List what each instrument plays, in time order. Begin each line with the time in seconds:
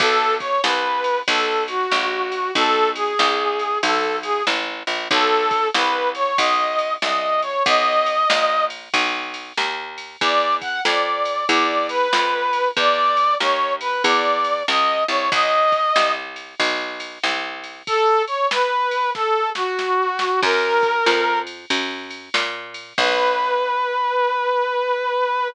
0.00 electric bass (finger) B1, brass section A4, kick, ride
0.40 brass section C#5, kick, ride
0.64 electric bass (finger) C2, brass section B4, snare
1.04 ride
1.28 electric bass (finger) B1, brass section A4, kick, ride
1.68 brass section F#4, ride
1.91 electric bass (finger) A#1, snare
2.32 ride
2.55 electric bass (finger) B1, brass section A4, kick, ride
2.96 brass section G#4, ride
3.19 electric bass (finger) C2, snare
3.59 ride
3.83 electric bass (finger) B1, brass section A4, kick, ride
4.23 brass section G#4, ride
4.47 electric bass (finger) A1, snare
4.87 electric bass (finger) A#1, ride
5.11 electric bass (finger) B1, brass section A4, kick, ride
5.51 kick, ride
5.74 electric bass (finger) C2, brass section B4, snare
6.15 brass section C#5, ride
6.38 electric bass (finger) B1, brass section D#5, kick, ride
6.79 ride
7.02 electric bass (finger) C2, brass section D#5, snare
7.42 brass section C#5, ride
7.66 electric bass (finger) B1, brass section D#5, kick, ride
8.06 ride
8.30 electric bass (finger) A#1, snare
8.70 ride
8.94 electric bass (finger) B1, kick, ride
9.34 ride
9.57 electric bass (finger) D#2, snare
9.98 ride
10.21 electric bass (finger) E2, brass section D5, kick, ride
10.62 brass section F#5, kick, ride
10.85 electric bass (finger) F2, brass section D5, snare
11.25 ride
11.49 electric bass (finger) E2, brass section D5, kick, ride
11.89 brass section B4, ride
12.13 electric bass (finger) F2, snare
12.53 ride
12.77 electric bass (finger) E2, brass section D5, kick, ride
13.17 ride
13.40 electric bass (finger) D#2, brass section C#5, snare
13.81 brass section B4, ride
14.04 electric bass (finger) E2, brass section D5, kick, ride
14.45 ride
14.68 electric bass (finger) C#2, brass section D#5, snare
15.08 electric bass (finger) C2, brass section C#5, ride
15.32 electric bass (finger) B1, brass section D#5, kick, ride
15.72 kick, ride
15.96 electric bass (finger) C2, snare
16.36 ride
16.60 electric bass (finger) B1, kick, ride
17.00 ride
17.23 electric bass (finger) C2, snare
17.64 ride
17.87 brass section A4, kick, ride
18.28 brass section C#5, ride
18.51 brass section B4, snare
18.91 ride
19.15 brass section A4, kick, snare
19.55 brass section F#4, snare
19.79 snare
20.19 snare
20.43 electric bass (finger) F#2, brass section A#4, kick, crash
20.83 kick, ride
21.06 electric bass (finger) F2, snare
21.47 ride
21.70 electric bass (finger) F#2, kick, ride
22.11 ride
22.34 electric bass (finger) A#2, snare
22.74 ride
22.98 electric bass (finger) B1, brass section B4, kick, crash